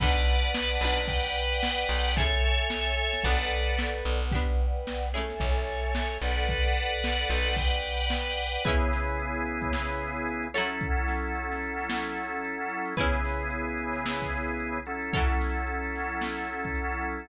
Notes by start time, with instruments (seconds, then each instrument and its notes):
0.00 electric bass (finger) B1, pizzicato strings D4 F#4 A4 B4, drawbar organ B4 D5 F#5 A5, kick, crash
0.16 closed hi-hat
0.27 closed hi-hat
0.44 closed hi-hat
0.55 snare
0.70 closed hi-hat
0.81 electric bass (finger) B1, pizzicato strings F#4 G4 B4, closed hi-hat
0.85 pizzicato strings D4
0.97 snare, closed hi-hat
1.08 drawbar organ B4 D5 F#5 G5, kick, closed hi-hat
1.24 closed hi-hat
1.35 closed hi-hat
1.51 closed hi-hat
1.63 snare
1.79 closed hi-hat
1.89 electric bass (finger) B1, closed hi-hat
2.04 closed hi-hat
2.16 pizzicato strings C#4 E4 G#4 A4, drawbar organ A4 C#5 E5 G#5, kick, closed hi-hat
2.32 closed hi-hat
2.43 closed hi-hat
2.59 closed hi-hat
2.70 snare
2.86 snare, closed hi-hat
2.97 closed hi-hat
3.13 snare, closed hi-hat
3.24 electric bass (finger) B1, pizzicato strings D4 F#4 A4, drawbar organ A4 B4 D5 F#5, kick, closed hi-hat
3.28 pizzicato strings B3
3.39 snare, closed hi-hat
3.51 closed hi-hat
3.67 closed hi-hat
3.79 snare
3.94 closed hi-hat
4.04 electric bass (finger) B1, closed hi-hat
4.22 snare, closed hi-hat
4.32 pizzicato strings D4 F#4 G4, drawbar organ B4 D5 F#5 G5, kick, closed hi-hat
4.36 pizzicato strings B3
4.49 closed hi-hat
4.59 closed hi-hat
4.75 closed hi-hat
4.87 snare
5.03 closed hi-hat
5.13 pizzicato strings C#4 E4 G#4, drawbar organ A4 C#5 E5 G#5, snare, closed hi-hat
5.17 pizzicato strings A3
5.30 snare, closed hi-hat
5.40 electric bass (finger) B1, kick, closed hi-hat
5.56 snare, closed hi-hat
5.68 closed hi-hat
5.82 closed hi-hat
5.95 snare
6.11 closed hi-hat
6.22 electric bass (finger) B1, drawbar organ A4 B4 D5 F#5, closed hi-hat
6.37 closed hi-hat
6.48 kick, closed hi-hat
6.64 snare, closed hi-hat
6.75 closed hi-hat
6.91 closed hi-hat
7.04 snare
7.19 closed hi-hat
7.30 electric bass (finger) B1, closed hi-hat
7.46 snare, closed hi-hat
7.56 drawbar organ B4 D5 F#5 G5, kick, closed hi-hat
7.73 closed hi-hat
7.83 closed hi-hat
8.00 closed hi-hat
8.10 snare
8.26 snare, closed hi-hat
8.39 closed hi-hat
8.53 closed hi-hat
8.65 drawbar organ C#3 B3 E4 G#4, pizzicato strings C#4 E4 G#4 B4, kick, closed hi-hat
8.81 closed hi-hat
8.91 snare, closed hi-hat
9.07 closed hi-hat
9.19 closed hi-hat
9.34 closed hi-hat
9.45 closed hi-hat
9.62 kick, closed hi-hat
9.73 snare
9.88 closed hi-hat
10.01 closed hi-hat
10.16 closed hi-hat
10.28 closed hi-hat
10.43 closed hi-hat
10.54 drawbar organ F#3 C#4 E4 A4, pizzicato strings F#3 E4 A4 C#5, closed hi-hat
10.69 closed hi-hat
10.80 kick, closed hi-hat
10.96 closed hi-hat
11.07 snare, closed hi-hat
11.25 closed hi-hat
11.35 closed hi-hat
11.50 snare, closed hi-hat
11.63 closed hi-hat
11.78 snare, closed hi-hat
11.90 snare
12.05 snare, closed hi-hat
12.17 closed hi-hat
12.32 closed hi-hat
12.44 closed hi-hat
12.58 closed hi-hat
12.70 closed hi-hat
12.85 open hi-hat
12.97 drawbar organ C#3 B3 E4 G#4, pizzicato strings C#4 E4 G#4 B4, kick, closed hi-hat
13.14 closed hi-hat
13.24 snare, closed hi-hat
13.40 closed hi-hat
13.50 closed hi-hat
13.68 closed hi-hat
13.78 closed hi-hat
13.93 snare, closed hi-hat
14.06 snare
14.22 kick, closed hi-hat
14.32 closed hi-hat
14.48 closed hi-hat
14.60 closed hi-hat
14.75 closed hi-hat
14.86 drawbar organ F#3 C#4 E4 A4, closed hi-hat
15.01 closed hi-hat
15.13 pizzicato strings F#3 E4 A4 C#5, kick, closed hi-hat
15.29 snare, closed hi-hat
15.41 snare, closed hi-hat
15.57 closed hi-hat
15.67 closed hi-hat
15.83 closed hi-hat
15.95 snare, closed hi-hat
16.11 closed hi-hat
16.21 snare
16.38 closed hi-hat
16.49 closed hi-hat
16.64 kick, closed hi-hat
16.75 closed hi-hat
16.91 closed hi-hat
17.01 closed hi-hat
17.19 closed hi-hat